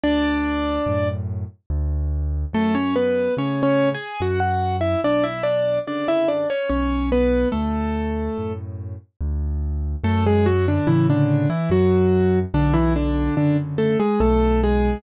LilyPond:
<<
  \new Staff \with { instrumentName = "Acoustic Grand Piano" } { \time 3/4 \key fis \minor \tempo 4 = 72 <d' d''>4. r4. | <a a'>16 <cis' cis''>16 <b b'>8 \tuplet 3/2 { <cis' cis''>8 <cis' cis''>8 <gis' gis''>8 } <fis' fis''>16 <fis' fis''>8 <e' e''>16 | <d' d''>16 <e' e''>16 <d' d''>8 <d' d''>16 <e' e''>16 <d' d''>16 <cis' cis''>16 <cis' cis''>8 <b b'>8 | <a a'>4. r4. |
<a a'>16 <gis gis'>16 <fis fis'>16 <d d'>16 <e e'>16 <d d'>8 <e e'>16 <fis fis'>4 | <d d'>16 <e e'>16 <d d'>8 <d d'>16 r16 <a a'>16 <gis gis'>16 <a a'>8 <gis gis'>8 | }
  \new Staff \with { instrumentName = "Acoustic Grand Piano" } { \clef bass \time 3/4 \key fis \minor d,4 <fis, a,>4 d,4 | fis,4 <a, cis>4 fis,4 | b,,4 <fis, cis d>4 b,,4 | d,4 <fis, a,>4 d,4 |
fis,4 <a, cis>4 fis,4 | b,,4 <fis, cis d>4 b,,4 | }
>>